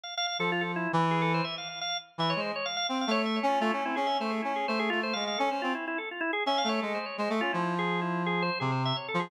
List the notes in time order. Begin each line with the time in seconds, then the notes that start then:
0.03 F5
0.17 F5
0.27 F5
0.39 F3 A4
0.52 F4
0.61 A4
0.76 E4
0.93 E3
1.11 G#4
1.22 A4
1.34 C5
1.44 E5
1.58 F5
1.69 F5
1.81 F5
2.18 E3 E5
2.30 C#5
2.36 G#3
2.40 C5
2.56 C#5
2.66 F5
2.77 F5
2.87 C4 F5
3.01 F5
3.07 A3 C#5
3.26 E5
3.36 C#5
3.43 C#4
3.49 F4
3.60 A3 F4
3.71 C#4 E4
3.85 C4 E4
3.96 C#4 G#4
4.07 E5
4.20 A3 C5
4.30 G#4
4.42 C#4 E4
4.56 G#4
4.68 A3 C5
4.79 G#4
4.90 A3 F4
5.03 C5
5.13 G#3 F5
5.27 F5
5.38 C#4 A4
5.51 C#4 C5
5.62 C4 F4
5.75 E4
5.88 E4
5.98 A4
6.11 F4
6.21 E4
6.33 G#4
6.46 C#4 E5
6.58 F5
6.64 A3
6.69 C#5
6.82 G#3 A4
6.95 C5
7.06 C#5
7.18 G#3 C5
7.30 A3 A4
7.41 C#4 F4
7.53 F3 E4
7.79 G#4
8.02 E4
8.26 G#4
8.42 C5
8.60 C3 G#4
8.72 C5
8.85 E5
8.96 C#5
9.08 A4
9.14 F3
9.20 G#4